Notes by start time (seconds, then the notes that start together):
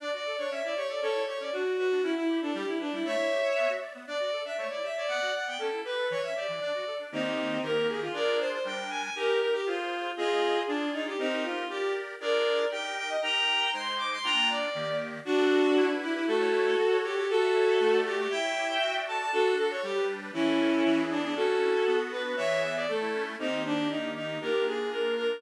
0.00 D4 D5
0.13 F#4 D5
0.26 A4
0.38 D4 C#5
0.51 C#4 E5
0.64 E4 D5
0.76 G4 C#5
0.89 A4 D5
1.01 C#4 A4 C#5
1.14 E4
1.27 G4 C#5
1.40 C#4 D5
1.52 D4 F#4
1.65 F#4
1.78 F#4 B4
1.91 D4
2.03 C#4 E4
2.16 E4
2.29 G4
2.41 D4 A4
2.54 G3 G4
2.67 E4
2.80 D4 B4
2.92 G3 E4
3.05 A3 C#5 E5
3.18 E4
3.31 G4
3.43 C#5
3.56 B3
3.69 F#4
3.81 D5
3.94 B3
4.07 D4 D5
4.20 F#4 D5
4.32 A4
4.45 D4 E5
4.58 A3 C#5
4.70 E4 D5
4.83 G4 E5
4.96 C#5 D5
5.08 B3 D5 F#5
5.21 F#4
5.34 D5 F#5
5.47 B3 G5
5.59 C#4 A4
5.72 E4
5.85 G4 B4
5.98 A4
6.10 E3 C#5
6.23 C#4 E5
6.36 G4 D5
6.48 E3
6.61 D4 D5
6.74 F#4
6.87 A4
6.99 D4
7.12 D#3 A#3 C4 D#4 G4
7.62 D#3 A#3 G4 A#4
7.88 G#4
8.01 F4
8.13 D4 F4 G#4 A#4 D5
8.39 C5
8.52 C5
8.64 G3 D4 A#4 G5
8.90 G#5
9.02 G#5
9.15 D#4 G4 A#4
9.40 A#4
9.53 G4
9.66 F4 G#4 C5
10.17 C4 F4 G#4 D#5
10.67 D4 F4 G#4 D5
10.93 D#4
11.06 G4
11.18 C4 D#4 G4 A#4
11.43 F4
11.69 G4 A#4 D5
12.20 D4 F4 G#4 A#4 D5
12.71 D#4 G4 A#4 G5
12.97 G5
13.09 D#5
13.22 D#4 G4 A#4 G5 A#5
13.73 G#3 D#4 C5 C6
13.98 D6
14.12 C6
14.24 A#3 D4 F4 G5 A#5
14.50 D5
14.75 D#3 A#3 G4
15.25 D4 F#4
15.38 A4
15.51 F#4
15.64 A4
15.76 E4
15.89 B4
16.02 E4 G4
16.14 E4 B4
16.27 A3 F#4 A4
16.40 C#5
16.53 E4
16.65 C#5
16.78 F#4
16.91 C#5
17.03 G4 A4
17.16 G4 C#5
17.29 F#4 A4
17.42 E5
17.54 C#5
17.67 E5
17.80 A3
17.92 D5
18.05 F#4 G4
18.18 G4 D5
18.30 E4 E5 G5
18.43 C#5
18.56 G4
18.69 C#5
18.81 F#4
18.94 D5
19.07 A4 A5
19.19 D5 A5
19.32 D4 F#4 A4
19.45 A4
19.57 F#4 A4
19.70 A4 C#5
19.83 G3 G4
19.96 B4
20.08 D4
20.21 B4
20.33 E3 C#4 E4
20.46 A4
20.59 C#4
20.72 A4
20.85 E3
20.98 G#4
21.10 B3 D4
21.23 D4 G#4
21.36 C#4 F#4 A4
21.48 A4
21.61 E4
21.74 A4
21.87 B3
21.99 F#4
22.12 D4 B4
22.24 F#4 B4
22.37 E3 C#5 E5
22.50 G#4
22.62 B3 E5
22.75 G#4 D5
22.88 A3 A4
23.01 E4
23.14 C#4
23.26 E4
23.39 D#3 A#3 C4 D#4 G4
23.64 D4
23.90 D#4
24.15 D#4
24.41 A#3 D4 F4 G4 A#4
24.66 G#4
24.91 A#4
25.17 A#4